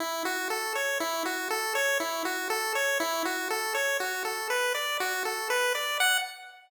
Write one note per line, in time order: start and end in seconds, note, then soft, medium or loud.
0.00 0.23 E4 medium
0.25 0.48 F#4 medium
0.50 0.73 A4 medium
0.75 0.98 C#5 medium
1.00 1.23 E4 medium
1.25 1.48 F#4 medium
1.51 1.73 A4 medium
1.75 1.98 C#5 medium
2.00 2.23 E4 medium
2.25 2.48 F#4 medium
2.50 2.73 A4 medium
2.75 2.98 C#5 medium
3.00 3.23 E4 medium
3.25 3.48 F#4 medium
3.50 3.73 A4 medium
3.75 3.98 C#5 medium
4.00 4.23 F#4 medium
4.25 4.48 A4 medium
4.50 4.73 B4 medium
4.74 4.97 D5 medium
5.00 5.23 F#4 medium
5.25 5.48 A4 medium
5.50 5.73 B4 medium
5.75 5.98 D5 medium
6.00 6.18 F#5 loud